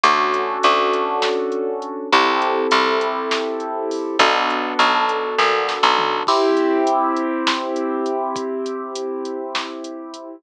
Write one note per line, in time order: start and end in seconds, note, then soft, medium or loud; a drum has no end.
0.03 0.58 D2 medium
0.03 2.08 C#4 medium
0.03 2.08 D4 medium
0.03 2.08 F#4 medium
0.03 2.08 A4 medium
0.03 kick medium
0.03 closed hi-hat loud
0.34 closed hi-hat medium
0.63 2.01 D2 medium
0.63 closed hi-hat loud
0.93 closed hi-hat medium
1.22 snare loud
1.52 closed hi-hat medium
1.82 closed hi-hat medium
2.12 2.67 C2 medium
2.12 4.16 C4 medium
2.12 4.16 E4 medium
2.12 4.16 G4 medium
2.12 4.16 A4 medium
2.12 kick medium
2.12 closed hi-hat medium
2.42 closed hi-hat medium
2.71 4.08 C2 medium
2.71 closed hi-hat loud
3.01 closed hi-hat medium
3.31 snare loud
3.60 closed hi-hat medium
3.91 open hi-hat medium
4.19 4.74 B1 medium
4.19 6.24 B3 medium
4.19 6.24 D4 medium
4.19 6.24 F#4 medium
4.19 6.24 A4 medium
4.19 kick loud
4.19 closed hi-hat loud
4.50 closed hi-hat medium
4.79 5.35 B1 medium
4.79 closed hi-hat medium
5.09 closed hi-hat medium
5.38 5.79 A#1 medium
5.38 kick medium
5.38 snare medium
5.69 snare medium
5.83 6.23 B1 medium
5.98 floor tom loud
6.27 10.36 C4 medium
6.27 10.36 E4 medium
6.27 10.36 G4 medium
6.27 kick medium
6.27 crash loud
6.57 closed hi-hat medium
6.87 closed hi-hat loud
7.16 closed hi-hat medium
7.47 snare loud
7.76 closed hi-hat medium
8.06 closed hi-hat medium
8.36 kick loud
8.36 closed hi-hat loud
8.66 closed hi-hat medium
8.95 closed hi-hat loud
9.25 closed hi-hat medium
9.55 snare loud
9.84 closed hi-hat medium
10.14 closed hi-hat medium